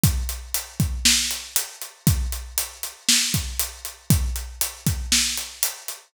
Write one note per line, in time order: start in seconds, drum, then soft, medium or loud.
0.03 kick loud
0.03 closed hi-hat loud
0.29 closed hi-hat medium
0.54 closed hi-hat loud
0.80 kick loud
0.80 closed hi-hat medium
1.05 snare loud
1.31 closed hi-hat medium
1.56 closed hi-hat loud
1.81 closed hi-hat medium
2.07 kick loud
2.07 closed hi-hat loud
2.32 closed hi-hat medium
2.58 closed hi-hat loud
2.83 closed hi-hat medium
3.09 snare loud
3.34 kick medium
3.34 closed hi-hat medium
3.59 closed hi-hat loud
3.85 closed hi-hat medium
4.10 kick loud
4.10 closed hi-hat loud
4.36 closed hi-hat medium
4.61 closed hi-hat loud
4.87 kick loud
4.87 closed hi-hat medium
5.12 snare loud
5.37 closed hi-hat medium
5.63 closed hi-hat loud
5.88 closed hi-hat medium